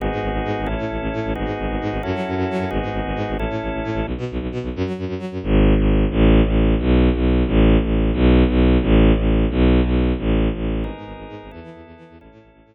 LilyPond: <<
  \new Staff \with { instrumentName = "Drawbar Organ" } { \time 12/8 \key gis \phrygian \tempo 4. = 177 <b dis' fis' gis'>2. <cis' e' a'>2. | <b dis' fis' gis'>2. <cis' e' fis' a'>2. | <b dis' fis' gis'>2. <cis' e' a'>2. | r1. |
r1. | r1. | r1. | r1. |
<b dis' gis' ais'>2. <b e' a'>2. | <cis' e' a'>2. r2. | }
  \new Staff \with { instrumentName = "Violin" } { \clef bass \time 12/8 \key gis \phrygian gis,,8 gis,8 gis,,8 gis,,8 gis,8 gis,,8 a,,8 a,8 a,,8 a,,8 a,8 a,,8 | gis,,8 gis,8 gis,,8 gis,,8 gis,8 gis,,8 fis,8 fis8 fis,8 fis,8 fis8 fis,8 | gis,,8 gis,8 gis,,8 gis,,8 gis,8 gis,,8 a,,8 a,8 a,,8 a,,8 a,8 a,,8 | b,,8 b,8 b,,8 b,,8 b,8 b,,8 fis,8 fis8 fis,8 fis,8 fis8 fis,8 |
gis,,4. gis,,4. a,,4. a,,4. | b,,4. b,,4. a,,4. a,,4. | b,,4. b,,4. a,,4. a,,4. | b,,4. b,,4. a,,4. a,,4. |
gis,,8 gis,8 gis,,8 gis,,8 gis,8 gis,,8 e,8 e8 e,8 e,8 e8 e,8 | a,,8 a,8 a,,8 a,,8 a,8 r2. r8 | }
>>